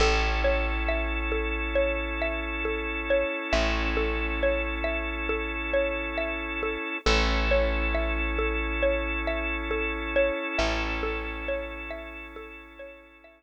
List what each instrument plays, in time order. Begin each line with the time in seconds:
0.00 electric bass (finger) A1, drawbar organ C#4 E4 A4, xylophone A4
0.44 xylophone C#5
0.88 xylophone E5
1.32 xylophone A4
1.75 xylophone C#5
2.22 xylophone E5
2.65 xylophone A4
3.10 xylophone C#5
3.53 electric bass (finger) A1, xylophone E5
3.97 xylophone A4
4.43 xylophone C#5
4.84 xylophone E5
5.29 xylophone A4
5.74 xylophone C#5
6.18 xylophone E5
6.63 xylophone A4
7.06 electric bass (finger) A1, drawbar organ C#4 E4 A4, xylophone A4
7.51 xylophone C#5
7.94 xylophone E5
8.39 xylophone A4
8.83 xylophone C#5
9.27 xylophone E5
9.71 xylophone A4
10.16 xylophone C#5
10.58 electric bass (finger) A1, xylophone E5
11.03 xylophone A4
11.48 xylophone C#5
11.90 xylophone E5
12.36 xylophone A4
12.79 xylophone C#5
13.24 xylophone E5